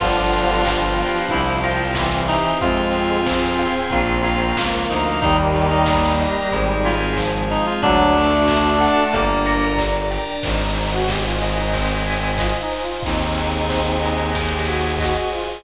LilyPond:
<<
  \new Staff \with { instrumentName = "Clarinet" } { \time 4/4 \key c \minor \tempo 4 = 92 f'2 e'8 f'4 ees'8 | f'2 f'8 f'4 ees'8 | ees'16 r8 ees'8. r4 f'8 r8 ees'16 f'16 | d'2 bes4 r4 |
r1 | r1 | }
  \new Staff \with { instrumentName = "Brass Section" } { \time 4/4 \key c \minor <d f>4 f2 e4 | <aes c'>4 c'2 bes4 | <ees g>4 g2 f4 | fis8 a2 r4. |
ees'8. fis'16 g'16 f'8 ees'16 c'4 \tuplet 3/2 { f'8 ees'8 f'8 } | <c' ees'>2 r16 g'16 ges'8 ges'16 ges'16 f'16 f'16 | }
  \new Staff \with { instrumentName = "Electric Piano 1" } { \time 4/4 \key c \minor <b d' f' g'>4 <b d' f' g'>4 <c' e' g'>4 <c' e' g'>4 | <c' f' aes'>4 <c' f' aes'>4 <bes c' f'>4 <bes c' f'>4 | <bes ees' g'>2 <c' ees' aes'>2 | <d' fis' a'>2 <d' g' bes'>2 |
r1 | r1 | }
  \new Staff \with { instrumentName = "Tubular Bells" } { \time 4/4 \key c \minor b'8 g''8 b'8 f''8 c''8 g''8 c''8 e''8 | c''8 aes''8 c''8 f''8 bes'8 f''8 bes'8 c''8 | bes'8 g''8 bes'8 ees''8 c''8 aes''8 c''8 ees''8 | d''8 a''8 d''8 fis''8 d''8 bes''8 d''8 g''8 |
c''8 aes''8 c''8 ees''8 c''8 aes''8 ees''8 c''8 | c''8 aes''8 c''8 ees''8 c''8 aes''8 ees''8 c''8 | }
  \new Staff \with { instrumentName = "Violin" } { \clef bass \time 4/4 \key c \minor g,,2 c,2 | f,2 bes,,4 des,8 d,8 | ees,2 aes,,2 | d,2 g,,2 |
aes,,1 | ees,1 | }
  \new Staff \with { instrumentName = "Pad 5 (bowed)" } { \time 4/4 \key c \minor <b d' f' g'>4 <b d' g' b'>4 <c' e' g'>4 <c' g' c''>4 | <c' f' aes'>4 <c' aes' c''>4 <bes c' f'>4 <f bes f'>4 | <bes ees' g'>4 <bes g' bes'>4 <c' ees' aes'>4 <aes c' aes'>4 | <d' fis' a'>4 <d' a' d''>4 <d' g' bes'>4 <d' bes' d''>4 |
<c'' ees'' aes''>1 | <aes' c'' aes''>1 | }
  \new DrumStaff \with { instrumentName = "Drums" } \drummode { \time 4/4 <cymc bd>8 hho8 <hc bd>8 hho8 <hh bd>8 hho8 <bd sn>8 hho8 | <hh bd>8 hho8 <bd sn>8 hho8 <hh bd>8 hho8 <bd sn>8 hho8 | <hh bd>8 hho8 <bd sn>8 hho8 <hh bd>8 hho8 <hc bd>8 hho8 | <hh bd>8 hho8 <bd sn>8 hho8 <hh bd>8 hho8 <hc bd>8 hho8 |
<cymc bd>8 cymr8 <bd sn>8 <cymr sn>8 <bd cymr>8 cymr8 <hc bd>8 cymr8 | <bd cymr>8 cymr8 <bd sn>8 cymr8 <bd cymr>8 cymr8 <hc bd>8 cymr8 | }
>>